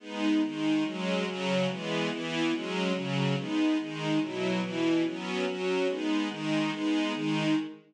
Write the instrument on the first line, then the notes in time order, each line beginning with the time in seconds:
string ensemble 1
0.00 G#3 B3 D#4
0.42 D#3 G#3 D#4
0.84 F#3 G#3 C#4
1.26 C#3 F#3 C#4
1.68 E3 G#3 B3
2.10 E3 B3 E4
2.52 F#3 G#3 C#4
2.94 C#3 F#3 C#4
3.36 G#3 B3 D#4
3.78 D#3 G#3 D#4
4.19 B2 F#3 E4
4.62 B2 E3 E4
5.04 F#3 B3 C#4
5.46 F#3 C#4 F#4
5.87 G#3 B3 D#4
6.29 D#3 G#3 D#4
6.71 G#3 B3 D#4
7.13 D#3 G#3 D#4